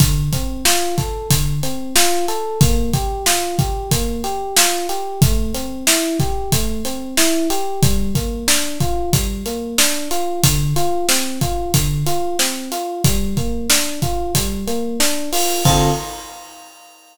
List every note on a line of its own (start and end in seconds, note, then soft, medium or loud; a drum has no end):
0.00 0.30 D3 medium
0.00 kick loud
0.00 closed hi-hat loud
0.33 0.63 C4 medium
0.33 kick medium
0.33 closed hi-hat medium
0.65 0.95 F4 medium
0.65 snare loud
0.98 1.28 A4 medium
0.98 kick medium
0.98 snare soft
0.98 closed hi-hat medium
1.30 1.60 D3 medium
1.30 kick loud
1.30 closed hi-hat loud
1.63 1.93 C4 medium
1.63 closed hi-hat medium
1.96 2.26 F4 loud
1.96 snare loud
2.28 2.58 A4 medium
2.28 closed hi-hat medium
2.61 2.91 A#3 medium
2.61 kick loud
2.61 closed hi-hat loud
2.93 3.24 G4 medium
2.93 kick loud
2.93 closed hi-hat medium
3.26 3.56 F4 medium
3.26 snare loud
3.59 3.89 G4 medium
3.59 kick loud
3.59 closed hi-hat medium
3.91 4.21 A#3 medium
3.91 kick loud
3.91 closed hi-hat loud
4.24 4.54 G4 medium
4.24 closed hi-hat medium
4.57 4.87 F4 medium
4.57 snare loud
4.89 5.19 G4 medium
4.89 closed hi-hat medium
5.22 5.52 A3 medium
5.22 kick loud
5.22 closed hi-hat loud
5.54 5.84 C4 medium
5.54 closed hi-hat medium
5.87 6.17 E4 medium
5.87 snare loud
6.19 6.50 G4 medium
6.19 kick loud
6.19 snare soft
6.19 closed hi-hat medium
6.52 6.82 A3 medium
6.52 kick loud
6.52 closed hi-hat loud
6.85 7.15 C4 medium
6.85 closed hi-hat medium
7.17 7.47 E4 medium
7.17 snare loud
7.50 7.80 G4 medium
7.50 closed hi-hat medium
7.82 8.13 G3 loud
7.82 kick loud
7.82 closed hi-hat loud
8.15 8.45 A#3 medium
8.15 kick medium
8.15 closed hi-hat medium
8.48 8.78 D4 medium
8.48 snare loud
8.80 9.10 F4 medium
8.80 kick medium
8.80 closed hi-hat medium
9.13 9.43 G3 medium
9.13 kick loud
9.13 closed hi-hat loud
9.46 9.76 A#3 medium
9.46 closed hi-hat medium
9.78 10.08 D4 medium
9.78 snare loud
10.11 10.41 F4 medium
10.11 closed hi-hat medium
10.43 10.74 D3 loud
10.43 kick loud
10.43 closed hi-hat loud
10.76 11.06 F4 medium
10.76 closed hi-hat medium
11.09 11.39 C4 medium
11.09 snare loud
11.41 11.71 F4 medium
11.41 kick medium
11.41 closed hi-hat medium
11.74 12.04 D3 medium
11.74 kick loud
11.74 closed hi-hat loud
12.06 12.36 F4 medium
12.06 closed hi-hat medium
12.39 12.69 C4 medium
12.39 snare loud
12.72 13.02 F4 medium
12.72 closed hi-hat medium
13.04 13.34 G3 loud
13.04 kick loud
13.04 closed hi-hat loud
13.37 13.67 A#3 medium
13.37 kick medium
13.37 closed hi-hat medium
13.70 14.00 D4 medium
13.70 snare loud
14.02 14.32 F4 medium
14.02 kick medium
14.02 closed hi-hat medium
14.35 14.65 G3 medium
14.35 kick medium
14.35 closed hi-hat loud
14.67 14.97 A#3 medium
14.67 closed hi-hat medium
15.00 15.30 D4 medium
15.00 snare loud
15.32 15.63 F4 medium
15.32 open hi-hat medium
15.65 15.90 D3 medium
15.65 15.90 C4 loud
15.65 15.90 F4 loud
15.65 15.90 A4 loud
15.65 kick loud
15.65 crash loud